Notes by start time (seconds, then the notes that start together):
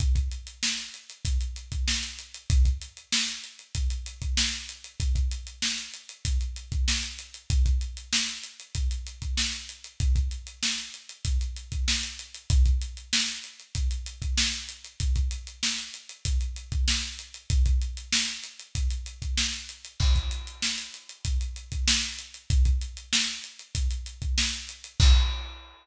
0.00 kick, closed hi-hat
0.15 kick, closed hi-hat
0.31 closed hi-hat
0.47 closed hi-hat
0.63 snare
0.78 closed hi-hat
0.94 closed hi-hat
1.10 closed hi-hat
1.25 kick, closed hi-hat
1.41 closed hi-hat
1.56 closed hi-hat
1.72 kick, closed hi-hat
1.88 snare
2.03 closed hi-hat
2.19 closed hi-hat
2.34 closed hi-hat
2.50 kick, closed hi-hat
2.65 kick, closed hi-hat
2.82 closed hi-hat
2.97 closed hi-hat
3.12 snare
3.29 closed hi-hat
3.44 closed hi-hat
3.59 closed hi-hat
3.75 kick, closed hi-hat
3.90 closed hi-hat
4.06 closed hi-hat
4.22 kick, closed hi-hat
4.37 snare
4.53 closed hi-hat
4.69 closed hi-hat
4.84 closed hi-hat
5.00 kick, closed hi-hat
5.15 kick, closed hi-hat
5.31 closed hi-hat
5.47 closed hi-hat
5.62 snare
5.78 closed hi-hat
5.94 closed hi-hat
6.09 closed hi-hat
6.25 kick, closed hi-hat
6.41 closed hi-hat
6.56 closed hi-hat
6.72 kick, closed hi-hat
6.88 snare
7.03 closed hi-hat
7.19 closed hi-hat
7.34 closed hi-hat
7.50 kick, closed hi-hat
7.66 kick, closed hi-hat
7.81 closed hi-hat
7.97 closed hi-hat
8.13 snare
8.28 closed hi-hat
8.43 closed hi-hat
8.60 closed hi-hat
8.75 kick, closed hi-hat
8.91 closed hi-hat
9.07 closed hi-hat
9.22 kick, closed hi-hat
9.37 snare
9.53 closed hi-hat
9.69 closed hi-hat
9.84 closed hi-hat
10.00 kick, closed hi-hat
10.16 kick, closed hi-hat
10.31 closed hi-hat
10.47 closed hi-hat
10.63 snare
10.78 closed hi-hat
10.94 closed hi-hat
11.09 closed hi-hat
11.25 kick, closed hi-hat
11.41 closed hi-hat
11.56 closed hi-hat
11.72 kick, closed hi-hat
11.88 snare
12.03 closed hi-hat
12.19 closed hi-hat
12.34 closed hi-hat
12.50 kick, closed hi-hat
12.65 kick, closed hi-hat
12.82 closed hi-hat
12.97 closed hi-hat
13.13 snare
13.28 closed hi-hat
13.44 closed hi-hat
13.60 closed hi-hat
13.75 kick, closed hi-hat
13.91 closed hi-hat
14.06 closed hi-hat
14.22 kick, closed hi-hat
14.38 snare
14.53 closed hi-hat
14.69 closed hi-hat
14.84 closed hi-hat
15.00 kick, closed hi-hat
15.16 kick, closed hi-hat
15.31 closed hi-hat
15.47 closed hi-hat
15.63 snare
15.78 closed hi-hat
15.94 closed hi-hat
16.09 closed hi-hat
16.25 kick, closed hi-hat
16.41 closed hi-hat
16.56 closed hi-hat
16.72 kick, closed hi-hat
16.88 snare
17.03 closed hi-hat
17.19 closed hi-hat
17.34 closed hi-hat
17.50 kick, closed hi-hat
17.66 kick, closed hi-hat
17.82 closed hi-hat
17.97 closed hi-hat
18.12 snare
18.28 closed hi-hat
18.43 closed hi-hat
18.59 closed hi-hat
18.75 kick, closed hi-hat
18.90 closed hi-hat
19.06 closed hi-hat
19.22 kick, closed hi-hat
19.38 snare
19.53 closed hi-hat
19.69 closed hi-hat
19.85 closed hi-hat
20.00 kick, crash
20.15 kick, closed hi-hat
20.31 closed hi-hat
20.47 closed hi-hat
20.62 snare
20.78 closed hi-hat
20.94 closed hi-hat
21.09 closed hi-hat
21.25 kick, closed hi-hat
21.41 closed hi-hat
21.56 closed hi-hat
21.72 kick, closed hi-hat
21.88 snare
22.03 closed hi-hat
22.19 closed hi-hat
22.34 closed hi-hat
22.50 kick, closed hi-hat
22.65 kick, closed hi-hat
22.81 closed hi-hat
22.97 closed hi-hat
23.13 snare
23.28 closed hi-hat
23.44 closed hi-hat
23.59 closed hi-hat
23.75 kick, closed hi-hat
23.90 closed hi-hat
24.06 closed hi-hat
24.22 kick, closed hi-hat
24.38 snare
24.53 closed hi-hat
24.69 closed hi-hat
24.84 closed hi-hat
25.00 kick, crash